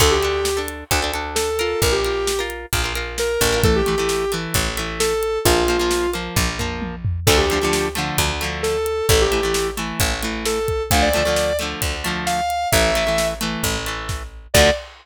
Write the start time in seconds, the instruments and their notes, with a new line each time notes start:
0.00 electric bass (finger) D2, acoustic guitar (steel) D4 A4, lead 1 (square) A4, kick, crash
0.11 lead 1 (square) G4
0.23 acoustic guitar (steel) D4 A4, closed hi-hat
0.45 snare
0.57 acoustic guitar (steel) D4 A4
0.68 closed hi-hat
0.91 electric bass (finger) D2, acoustic guitar (steel) D4 A4, kick, closed hi-hat
1.02 acoustic guitar (steel) D4 A4
1.14 acoustic guitar (steel) D4 A4, closed hi-hat
1.35 lead 1 (square) A4, snare
1.59 acoustic guitar (steel) F4 A#4, closed hi-hat
1.82 electric bass (finger) A#1, lead 1 (square) A#4, kick, closed hi-hat
1.92 lead 1 (square) G4
2.04 acoustic guitar (steel) F4 A#4, closed hi-hat
2.27 snare
2.39 acoustic guitar (steel) F4 A#4
2.50 closed hi-hat
2.73 electric bass (finger) A#1, acoustic guitar (steel) F4 A#4, kick, closed hi-hat
2.84 acoustic guitar (steel) F4 A#4
2.95 acoustic guitar (steel) F4 A#4, closed hi-hat
3.18 lead 1 (square) A#4, snare
3.41 electric bass (finger) A1, kick, closed hi-hat
3.52 acoustic guitar (steel) F4 A#4
3.63 acoustic guitar (steel) E3 A3, lead 1 (square) A4, kick, closed hi-hat
3.76 lead 1 (square) G4
3.86 acoustic guitar (steel) E3 A3, closed hi-hat
3.98 acoustic guitar (steel) E3 A3
4.09 snare
4.32 acoustic guitar (steel) E3 A3, closed hi-hat
4.54 electric bass (finger) A1, kick, closed hi-hat
4.77 acoustic guitar (steel) E3 A3, closed hi-hat
5.00 lead 1 (square) A4, snare
5.23 closed hi-hat
5.45 electric bass (finger) A#1, acoustic guitar (steel) F3 A#3, lead 1 (square) F4, kick, closed hi-hat
5.68 acoustic guitar (steel) F3 A#3, closed hi-hat
5.79 acoustic guitar (steel) F3 A#3
5.91 snare
6.13 acoustic guitar (steel) F3 A#3, closed hi-hat
6.36 electric bass (finger) A#1, kick, high tom
6.59 acoustic guitar (steel) F3 A#3, floor tom
6.82 high tom
7.05 floor tom
7.27 electric bass (finger) D2, acoustic guitar (steel) D3 F3 A3, lead 1 (square) A4, kick, crash
7.38 lead 1 (square) G4
7.50 acoustic guitar (steel) D3 F3 A3, closed hi-hat
7.61 acoustic guitar (steel) D3 F3 A3
7.73 snare
7.95 acoustic guitar (steel) D3 F3 A3, closed hi-hat
8.18 electric bass (finger) D2, kick, closed hi-hat
8.41 acoustic guitar (steel) D3 F3 A3, closed hi-hat
8.63 lead 1 (square) A4, snare
8.86 closed hi-hat
9.09 electric bass (finger) A1, acoustic guitar (steel) E3 A3, lead 1 (square) A4, kick, closed hi-hat
9.21 lead 1 (square) G4
9.32 acoustic guitar (steel) E3 A3, closed hi-hat
9.43 acoustic guitar (steel) E3 A3
9.54 snare
9.77 acoustic guitar (steel) E3 A3, closed hi-hat
10.00 electric bass (finger) A1, kick, closed hi-hat
10.23 acoustic guitar (steel) E3 A3, closed hi-hat
10.45 lead 1 (square) A4, snare
10.68 kick, closed hi-hat
10.91 electric bass (finger) D2, acoustic guitar (steel) D3 F3 A3, lead 1 (square) F5, kick, closed hi-hat
11.02 lead 1 (square) D5
11.14 acoustic guitar (steel) D3 F3 A3, closed hi-hat
11.25 acoustic guitar (steel) D3 F3 A3
11.36 snare
11.59 acoustic guitar (steel) D3 F3 A3, closed hi-hat
11.82 electric bass (finger) D2, kick, closed hi-hat
12.04 acoustic guitar (steel) D3 F3 A3, closed hi-hat
12.26 lead 1 (square) F5, snare
12.50 closed hi-hat
12.72 electric bass (finger) A1, acoustic guitar (steel) E3 A3, lead 1 (square) E5, kick, closed hi-hat
12.95 acoustic guitar (steel) E3 A3, closed hi-hat
13.07 acoustic guitar (steel) E3 A3
13.18 snare
13.41 acoustic guitar (steel) E3 A3, closed hi-hat
13.63 electric bass (finger) A1, kick, closed hi-hat
13.86 acoustic guitar (steel) E3 A3, closed hi-hat
14.09 kick, snare
14.54 electric bass (finger) D2, acoustic guitar (steel) D3 F3 A3, lead 1 (square) D5, kick, crash